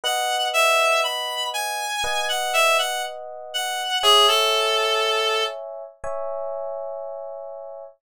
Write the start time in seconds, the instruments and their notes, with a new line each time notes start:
0.04 electric piano 1 B4 D#5 F#5, clarinet F#5
0.54 clarinet E5
1.04 clarinet B5
1.54 clarinet G#5
2.04 electric piano 1 B4 D#5 F#5
2.29 clarinet F#5
2.53 clarinet E5
2.79 clarinet F#5
3.54 clarinet F#5
4.03 clarinet G#4, electric piano 1 C#5 E5 G#5
4.28 clarinet A4
6.04 electric piano 1 C#5 E5 G#5